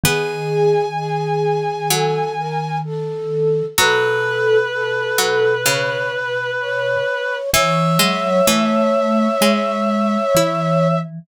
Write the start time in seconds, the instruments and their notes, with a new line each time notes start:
0.04 vibraphone D#3, harpsichord B3, flute G#4, clarinet G#5
0.97 flute G#4
1.90 harpsichord F#3, flute A4
2.38 flute A#4
2.85 flute A4
3.78 vibraphone B2, harpsichord F#3, flute A4, clarinet B4
4.73 flute A4
5.18 harpsichord F#3
5.66 harpsichord C#3, flute C#5
6.13 flute B4
6.60 flute C#5
7.53 vibraphone E3, harpsichord E3, flute C#5, clarinet E5
7.99 vibraphone F#3, harpsichord G#3
8.47 harpsichord E3, vibraphone A3
9.41 vibraphone G#3, harpsichord G#3
10.35 vibraphone E3, harpsichord E4